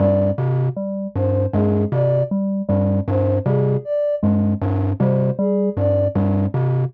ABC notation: X:1
M:3/4
L:1/8
Q:1/4=78
K:none
V:1 name="Glockenspiel" clef=bass
G,, C, z G,, G,, C, | z G,, G,, C, z G,, | G,, C, z G,, G,, C, |]
V:2 name="Electric Piano 2" clef=bass
G, z G, z ^G, z | G, G, z G, z ^G, | z G, G, z G, z |]
V:3 name="Ocarina"
d z2 c ^G d | z2 c ^G d z | z c ^G d z2 |]